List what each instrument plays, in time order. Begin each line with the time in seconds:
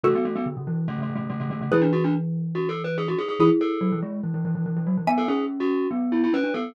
0.03 glockenspiel C#3 A3, xylophone F#4 A4
0.15 glockenspiel B3
0.25 glockenspiel A3
0.35 glockenspiel B3
0.46 glockenspiel D3
0.57 glockenspiel C#3
0.67 glockenspiel E3
0.88 glockenspiel C#3 A3
0.98 glockenspiel C#3 A3
1.09 glockenspiel C#3
1.15 glockenspiel C#3 A3
1.30 glockenspiel C#3 A3
1.40 glockenspiel C#3 A3
1.50 glockenspiel D3 A3
1.61 glockenspiel C#3 A3
1.72 glockenspiel E3 E4, xylophone G#4 B4
1.81 glockenspiel D4
1.93 glockenspiel F#4
2.04 glockenspiel D4
2.55 glockenspiel F#4
2.69 glockenspiel A4
2.84 glockenspiel B4
2.98 glockenspiel G#4
3.08 glockenspiel F#4
3.19 glockenspiel G#4
3.28 glockenspiel G#4
3.39 glockenspiel E3 G#4, xylophone E4 G#4
3.61 glockenspiel A4
3.81 glockenspiel F#3
3.92 glockenspiel E3
4.02 glockenspiel G#3
4.23 glockenspiel E3
4.34 glockenspiel E3
4.45 glockenspiel E3
4.55 glockenspiel E3
4.66 glockenspiel E3
4.76 glockenspiel E3
4.87 glockenspiel F#3
4.97 glockenspiel E3
5.07 glockenspiel B3, xylophone E5 G#5
5.18 glockenspiel A4
5.28 glockenspiel C#4 G#4
5.60 glockenspiel F#4
5.91 glockenspiel B3
6.12 glockenspiel E4
6.24 glockenspiel E4
6.33 glockenspiel C#4 B4
6.44 glockenspiel D4
6.54 glockenspiel B3 A4